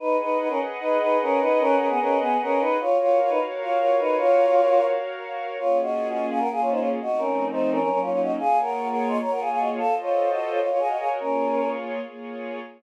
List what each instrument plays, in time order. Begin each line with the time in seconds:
0.00 choir aahs D#4 B4, pad 2 (warm) G#4 B4 D#5 F#5
0.21 choir aahs D#4 B4
0.39 choir aahs D#4 B4
0.48 choir aahs C#4 A#4
0.80 choir aahs D#4 B4
1.00 choir aahs D#4 B4
1.22 choir aahs C#4 A#4
1.40 choir aahs D#4 B4
1.59 choir aahs C#4 A#4
1.78 choir aahs C#4 A#4
1.89 choir aahs B3 G#4
2.00 choir aahs C#4 A#4
2.20 choir aahs B3 G#4
2.42 choir aahs C#4 A#4
2.60 choir aahs D#4 B4
2.80 choir aahs F4 C#5, pad 2 (warm) F#4 A#4 C#5 F5
3.00 choir aahs F4 C#5
3.20 choir aahs F4 C#5
3.29 choir aahs D#4 B4
3.61 choir aahs F4 C#5
3.79 choir aahs F4 C#5
3.99 choir aahs D#4 B4
4.18 choir aahs F4 C#5
5.59 pad 2 (warm) A#3 C#4 F4 G#4, choir aahs F4 C#5
5.81 choir aahs F#4 D#5
6.09 choir aahs F#4 D#5
6.30 choir aahs G#4 F5
6.39 pad 2 (warm) A#3 C#4 F4 G#4, choir aahs A#4 F#5
6.51 choir aahs G#4 F5
6.60 choir aahs F4 C#5
6.70 choir aahs D#4 C5
6.79 choir aahs F4 C#5
7.00 pad 2 (warm) F3 A3 C4 D#4, choir aahs F#4 D#5
7.18 choir aahs C#4 A#4
7.51 choir aahs D#4 C5
7.71 choir aahs C#4 A#4
7.80 pad 2 (warm) F#3 A#3 C#4 D#4, choir aahs C#4 A#4
7.89 choir aahs C#4 A#4
8.01 choir aahs F4 C#5
8.11 choir aahs F4 C#5
8.22 choir aahs F#4 D#5
8.39 pad 2 (warm) A#3 F4 G#4 C#5, choir aahs G#4 F5
8.61 choir aahs A#4 F#5
8.89 choir aahs A#4 F#5
9.08 choir aahs D#5 C6
9.20 pad 2 (warm) A#3 F4 G#4 C#5, choir aahs C#5 A#5
9.31 choir aahs A#4 F#5
9.40 choir aahs G#4 F5
9.50 choir aahs G#4 F5
9.59 choir aahs F#4 D#5
9.78 pad 2 (warm) F4 A4 C5 D#5, choir aahs A4 F5
10.01 choir aahs F4 C#5
10.30 choir aahs F#4 D#5
10.49 choir aahs F4 C#5
10.59 choir aahs F4 C#5, pad 2 (warm) F#4 A#4 C#5 D#5
10.69 choir aahs F4 C#5
10.79 choir aahs G#4 F5
10.88 choir aahs F#4 D#5
10.99 choir aahs G#4 F5
11.20 pad 2 (warm) A#3 F4 G#4 C#5, choir aahs C#4 A#4
12.00 pad 2 (warm) A#3 F4 G#4 C#5